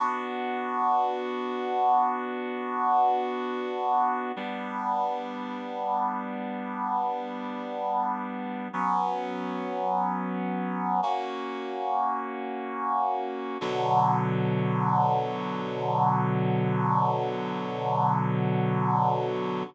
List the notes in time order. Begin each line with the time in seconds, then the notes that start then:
0.00 B3 D4 F#4
4.36 G3 B3 D4
8.73 F#3 B3 C#4
11.03 A#3 C#4 F#4
13.61 B2 D3 F#3